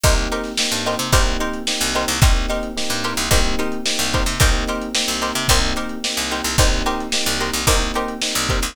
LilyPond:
<<
  \new Staff \with { instrumentName = "Pizzicato Strings" } { \time 4/4 \key c \minor \tempo 4 = 110 <ees' g' bes' c''>8 <ees' g' bes' c''>4 <ees' g' bes' c''>8 <ees' g' bes' c''>8 <ees' g' bes' c''>4 <ees' g' bes' c''>8 | <ees' g' bes' c''>8 <ees' g' bes' c''>4 <ees' g' bes' c''>8 <ees' g' bes' c''>8 <ees' g' bes' c''>4 <ees' g' bes' c''>8 | <ees' g' bes' c''>8 <ees' g' bes' c''>4 <ees' g' bes' c''>8 <ees' g' bes' c''>8 <ees' g' bes' c''>4 <ees' g' bes' c''>8 | <ees' g' bes' c''>8 <ees' g' bes' c''>4 <ees' g' bes' c''>8 <ees' g' bes' c''>8 <ees' g' bes' c''>4 <ees' g' bes' c''>8 | }
  \new Staff \with { instrumentName = "Electric Piano 1" } { \time 4/4 \key c \minor <bes c' ees' g'>4 <bes c' ees' g'>4 <bes c' ees' g'>4 <bes c' ees' g'>4 | <bes c' ees' g'>4 <bes c' ees' g'>4 <bes c' ees' g'>4 <bes c' ees' g'>4 | <bes c' ees' g'>4 <bes c' ees' g'>4 <bes c' ees' g'>4 <bes c' ees' g'>4 | <bes c' ees' g'>4 <bes c' ees' g'>4 <bes c' ees' g'>4 <bes c' ees' g'>4 | }
  \new Staff \with { instrumentName = "Electric Bass (finger)" } { \clef bass \time 4/4 \key c \minor c,4~ c,16 g,8 c16 c,4~ c,16 c,8 c,16 | c,4~ c,16 g,8 c,16 c,4~ c,16 c,8 c16 | c,4~ c,16 c,8 c16 c,4~ c,16 c,8 c,16 | c,4~ c,16 c,8 c,16 c,4~ c,16 c,8 c,16 | }
  \new DrumStaff \with { instrumentName = "Drums" } \drummode { \time 4/4 <hh bd>16 hh16 hh16 <hh sn>16 sn16 hh16 hh16 <hh sn>16 <hh bd>16 hh16 hh16 hh16 sn16 <hh sn>16 hh16 <hh sn>16 | <hh bd>16 <hh sn>16 hh16 hh16 sn16 hh16 hh16 <hh sn>16 <hh bd>16 hh16 hh16 hh16 sn16 hh16 <hh bd>16 <hh sn>16 | <hh bd>16 hh16 hh16 hh16 sn16 hh16 hh16 <hh sn>16 <hh bd>16 hh16 hh16 hh16 sn16 hh16 hh16 <hh sn>16 | <cymc bd>16 hh16 hh16 hh16 sn16 <hh sn>16 hh16 hh16 <hh bd>16 hh16 hh16 hh16 sn16 hh16 <hh bd>16 <hh sn>16 | }
>>